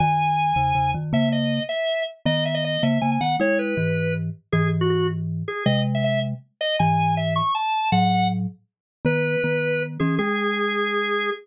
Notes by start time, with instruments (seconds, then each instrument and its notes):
0.00 marimba F#2 D#3, drawbar organ G#5
0.56 marimba E2 C#3
0.75 marimba E2 C#3
0.94 marimba F#2 D#3
1.13 marimba C#3 A#3, drawbar organ E5
1.32 drawbar organ D#5
1.69 drawbar organ E5
2.26 marimba D#3 B3, drawbar organ D#5
2.45 drawbar organ E5
2.54 drawbar organ D#5
2.65 drawbar organ D#5
2.83 marimba C#3 A#3, drawbar organ E5
3.01 marimba C#3 A#3, drawbar organ G#5
3.12 drawbar organ G#5
3.21 marimba D#3 B3, drawbar organ F#5
3.40 marimba G#3 E4, drawbar organ C#5
3.59 drawbar organ B4
3.77 marimba G#2 E3
4.52 marimba G#2 E3, drawbar organ G#4
4.81 drawbar organ F#4
4.90 drawbar organ F#4
5.48 drawbar organ G#4
5.66 marimba C3 G#3, drawbar organ D#5
5.95 drawbar organ E5
6.04 drawbar organ E5
6.61 drawbar organ D#5
6.79 marimba G#2 E3, drawbar organ G#5
7.17 drawbar organ E5
7.36 drawbar organ C#6
7.55 drawbar organ A5
7.92 marimba A2 F#3, drawbar organ F#5
9.05 marimba D#3 B3, drawbar organ B4
9.44 marimba D#3 B3
10.00 marimba E3 C#4, drawbar organ G#4
10.19 marimba G#3, drawbar organ G#4